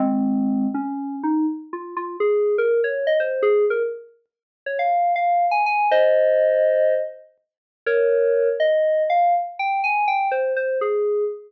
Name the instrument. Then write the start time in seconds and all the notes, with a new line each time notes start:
electric piano 2
0.00 G#3 C4
0.74 C#4
1.23 D#4
1.73 F4
1.97 F4
2.20 G#4
2.58 A#4
2.84 C#5
3.07 D#5
3.20 C5
3.43 G#4
3.70 A#4
4.66 C#5
4.79 F5
5.16 F5
5.51 G#5
5.66 G#5
5.91 C5 D#5
7.86 A#4 C#5
8.60 D#5
9.10 F5
9.59 G5
9.84 G#5
10.08 G5
10.31 C5
10.56 C5
10.81 G#4